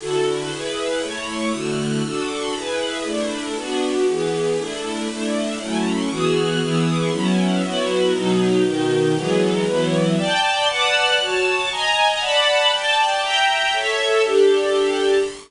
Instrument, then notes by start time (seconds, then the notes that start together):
string ensemble 1
0.00 D3 E4 F#4 A4
0.51 E4 G#4 B4
1.02 A3 E4 C#5
1.52 D3 A3 E4 F#4
2.04 D4 F#4 A4
2.54 E4 G#4 B4
3.04 A3 D4 E4
3.56 B3 D4 F#4
4.07 E3 B3 G#4
4.58 A3 D4 E4
5.08 A3 D4 E4
5.59 F#3 A3 C#4 E4
6.10 E3 B3 F#4 G#4
6.60 E3 B3 E4 G#4
7.12 F#3 B3 C#4 E4
7.62 F#3 B3 E4 F#4
8.13 B2 F#3 D#4
8.64 B2 D#3 D#4
9.16 E3 F#3 G#3 B3
9.65 E3 F#3 B3 E4
10.17 D5 G5 A5
10.68 B4 D5 F#5 A5
11.19 F#4 C#5 A5
11.70 D#5 G#5 A#5
12.20 D5 F#5 A5 B5
12.71 D5 G5 A5
13.22 E5 G5 A#5
13.73 A4 C#5 E5
14.24 D4 G4 A4